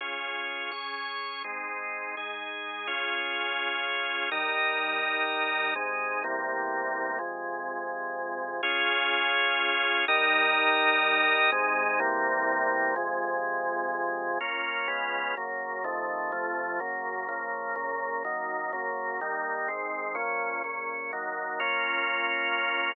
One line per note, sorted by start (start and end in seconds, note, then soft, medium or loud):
0.01 0.71 C#4 medium
0.01 0.72 F4 medium
0.01 0.71 G#4 medium
0.71 1.43 C#4 medium
0.71 1.43 G#4 medium
0.71 1.43 C#5 medium
1.44 2.15 G#3 medium
1.44 2.15 C4 medium
1.44 2.15 D#4 medium
2.17 2.88 G#3 medium
2.17 2.88 D#4 medium
2.17 2.87 G#4 medium
2.87 4.30 C#4 medium
2.87 4.30 F4 medium
2.87 4.30 G#4 medium
4.32 5.74 G3 medium
4.32 5.74 D#4 loud
4.32 5.74 A#4 loud
5.75 6.23 C3 medium
5.75 6.23 G#3 medium
5.75 6.23 D#4 medium
6.24 7.19 E2 medium
6.24 7.18 C3 medium
6.24 7.19 G3 medium
6.24 7.19 A#3 medium
7.19 8.61 F2 medium
7.19 8.61 C3 medium
7.19 8.61 G#3 medium
8.63 10.05 C#4 loud
8.63 10.05 F4 loud
8.63 10.05 G#4 loud
10.08 11.51 G3 loud
10.08 11.51 D#4 loud
10.08 11.51 A#4 loud
11.52 11.99 C3 loud
11.52 12.00 G#3 loud
11.52 12.00 D#4 loud
12.00 12.95 E2 loud
12.00 12.95 C3 loud
12.00 12.95 G3 loud
12.00 12.95 A#3 loud
12.96 14.38 F2 loud
12.96 14.38 C3 loud
12.96 14.38 G#3 loud
14.41 14.88 A#3 medium
14.41 14.88 C#4 medium
14.41 14.87 F4 medium
14.88 15.35 C#3 medium
14.88 15.35 G#3 medium
14.88 15.35 B3 medium
14.88 15.35 F4 medium
15.37 15.85 F#2 medium
15.37 15.85 C#3 medium
15.37 15.85 A#3 medium
15.84 16.32 F2 medium
15.84 16.32 C3 medium
15.84 16.32 D#3 medium
15.84 16.32 A3 medium
16.32 16.80 F2 medium
16.32 16.80 C3 medium
16.32 16.80 F3 medium
16.32 16.80 A3 medium
16.80 17.28 F#2 medium
16.80 17.28 C#3 medium
16.80 17.28 A#3 medium
17.29 17.75 C#3 medium
17.29 17.76 F3 medium
17.29 17.75 A#3 medium
17.76 18.23 A#2 medium
17.76 18.23 C#3 medium
17.76 18.23 A#3 medium
18.25 18.72 F#2 medium
18.25 18.72 D#3 medium
18.25 18.72 A#3 medium
18.73 19.20 F#2 medium
18.73 19.20 C#3 medium
18.73 19.20 A#3 medium
19.21 19.68 D#3 medium
19.21 19.69 G3 medium
19.21 19.69 A#3 medium
19.68 20.16 G#2 medium
19.68 20.16 D#3 medium
19.68 20.16 C4 medium
20.15 20.62 A#2 medium
20.15 20.62 F3 medium
20.15 20.62 C#4 medium
20.64 21.12 A#2 medium
20.64 21.12 C#3 medium
20.64 21.12 C#4 medium
21.13 21.60 D#3 medium
21.13 21.60 F#3 medium
21.13 21.59 A#3 medium
21.60 22.92 A#3 medium
21.60 22.92 C#4 loud
21.60 22.92 F4 loud